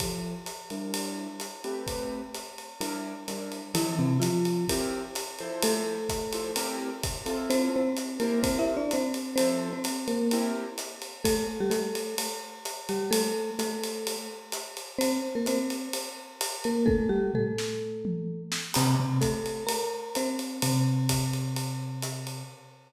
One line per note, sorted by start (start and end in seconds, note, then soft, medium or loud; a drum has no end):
0.00 0.33 F3 medium
0.00 0.33 E4 medium
0.00 0.33 G4 medium
0.00 0.33 A4 medium
0.00 kick medium
0.00 ride medium
0.46 hi-hat pedal medium
0.46 ride medium
0.70 1.27 G3 medium
0.70 1.27 D4 medium
0.70 1.27 E4 medium
0.70 1.27 A#4 medium
0.70 ride medium
0.94 ride medium
1.40 hi-hat pedal medium
1.40 ride medium
1.64 2.21 A3 medium
1.64 2.21 C4 medium
1.64 2.21 G4 medium
1.64 2.21 B4 medium
1.64 ride medium
1.87 kick medium
1.87 ride medium
2.34 hi-hat pedal medium
2.34 ride medium
2.58 ride medium
2.80 3.13 G3 medium
2.80 3.13 D4 medium
2.80 3.13 E4 medium
2.80 3.13 A#4 medium
2.80 ride medium
3.28 3.61 G3 medium
3.28 3.61 D4 medium
3.28 3.61 E4 medium
3.28 3.61 A#4 medium
3.28 hi-hat pedal medium
3.28 ride medium
3.52 ride medium
3.74 3.95 E3 medium
3.74 4.07 F3 medium
3.74 4.07 C4 medium
3.74 4.07 E4 medium
3.74 3.95 E4 loud
3.74 4.07 A4 medium
3.74 ride loud
3.99 4.18 C3 medium
3.99 4.18 C4 medium
4.20 4.65 F3 medium
4.20 4.65 F4 medium
4.20 hi-hat pedal medium
4.20 ride medium
4.45 ride medium
4.68 5.02 C4 medium
4.68 5.02 E4 medium
4.68 5.02 G4 medium
4.68 5.02 A#4 medium
4.68 kick medium
4.68 ride loud
5.15 hi-hat pedal medium
5.15 ride medium
5.39 5.97 F3 medium
5.39 5.97 E4 medium
5.39 5.97 A4 medium
5.39 5.97 C5 medium
5.39 ride medium
5.62 6.79 A3 medium
5.62 6.79 A4 loud
5.62 ride loud
6.09 kick medium
6.09 hi-hat pedal medium
6.09 ride medium
6.33 6.50 F3 medium
6.33 6.50 E4 medium
6.33 6.50 A4 medium
6.33 6.50 C5 medium
6.33 ride medium
6.56 6.89 C4 medium
6.56 6.89 E4 medium
6.56 6.89 G4 medium
6.56 6.89 A#4 medium
6.56 ride loud
7.03 kick medium
7.03 hi-hat pedal medium
7.03 ride medium
7.26 7.82 C4 medium
7.26 7.82 E4 medium
7.26 7.82 F4 medium
7.26 7.82 A4 medium
7.26 ride medium
7.50 7.69 C4 loud
7.50 7.69 C5 loud
7.50 ride medium
7.76 8.18 C4 medium
7.76 8.18 C5 medium
7.96 hi-hat pedal medium
7.96 ride medium
8.20 8.39 A#3 medium
8.20 8.77 E4 medium
8.20 8.77 G4 medium
8.20 8.39 A#4 medium
8.20 8.77 A#4 medium
8.20 8.77 C5 medium
8.20 ride medium
8.43 8.58 C4 medium
8.43 8.58 C5 medium
8.43 kick medium
8.43 ride loud
8.59 8.74 E4 medium
8.59 8.74 E5 medium
8.77 8.92 D4 medium
8.77 8.92 D5 medium
8.91 9.35 C4 medium
8.91 9.35 C5 medium
8.91 hi-hat pedal medium
8.91 ride medium
9.14 ride medium
9.36 9.71 F3 medium
9.36 9.69 C4 medium
9.36 9.71 E4 medium
9.36 9.71 A4 medium
9.36 9.69 C5 medium
9.36 9.71 C5 medium
9.36 ride loud
9.73 10.07 C4 medium
9.73 10.07 C5 medium
9.84 hi-hat pedal medium
9.84 ride medium
10.08 10.51 A#3 medium
10.08 10.51 A#4 medium
10.08 ride medium
10.31 10.66 C4 medium
10.31 10.66 E4 medium
10.31 10.66 G4 medium
10.31 10.66 A#4 medium
10.31 ride medium
10.78 hi-hat pedal medium
10.78 ride medium
11.02 ride medium
11.24 11.46 A3 medium
11.24 11.46 A4 loud
11.24 kick medium
11.24 ride loud
11.60 11.71 G3 medium
11.60 11.71 G4 medium
11.70 12.15 A3 medium
11.70 12.15 A4 medium
11.70 hi-hat pedal medium
11.70 ride medium
11.95 ride medium
12.18 ride loud
12.65 hi-hat pedal medium
12.65 ride medium
12.89 13.10 G3 medium
12.89 13.10 G4 medium
12.89 ride medium
13.11 13.50 A3 medium
13.11 13.50 A4 loud
13.11 ride loud
13.59 14.16 A3 medium
13.59 14.16 A4 medium
13.59 hi-hat pedal medium
13.59 ride medium
13.83 ride medium
14.07 ride medium
14.52 hi-hat pedal medium
14.52 ride medium
14.77 ride medium
14.99 15.20 C4 medium
14.99 15.20 C5 loud
14.99 ride loud
15.35 15.46 A#3 medium
15.35 15.46 A#4 medium
15.46 15.88 C4 medium
15.46 15.88 C5 medium
15.46 hi-hat pedal medium
15.46 ride medium
15.70 ride medium
15.93 ride loud
16.41 hi-hat pedal medium
16.41 ride loud
16.64 16.87 A#3 medium
16.64 16.87 A#4 medium
16.64 ride medium
16.86 17.08 A3 medium
16.86 17.08 A4 loud
16.86 kick medium
16.86 high tom medium
17.09 17.32 G3 medium
17.09 17.32 G4 medium
17.34 18.42 A3 medium
17.34 18.42 A4 medium
17.34 floor tom medium
17.58 snare medium
18.05 mid tom medium
18.52 snare loud
18.74 18.95 C3 medium
18.74 18.95 C4 loud
18.74 crash loud
18.74 ride loud
19.00 19.20 C3 medium
19.00 19.20 C4 medium
19.21 19.64 A3 medium
19.21 19.64 A4 medium
19.21 kick medium
19.21 hi-hat pedal medium
19.21 ride medium
19.46 ride medium
19.67 20.11 A#4 medium
19.67 20.11 A#5 medium
19.67 ride loud
20.15 20.61 C4 medium
20.15 20.61 C5 medium
20.15 hi-hat pedal medium
20.15 ride medium
20.39 ride medium
20.62 22.43 C3 medium
20.62 22.43 C4 medium
20.62 ride loud
21.09 kick medium
21.09 hi-hat pedal medium
21.09 ride loud
21.33 ride medium
21.56 ride medium
22.02 hi-hat pedal medium
22.02 ride medium
22.27 ride medium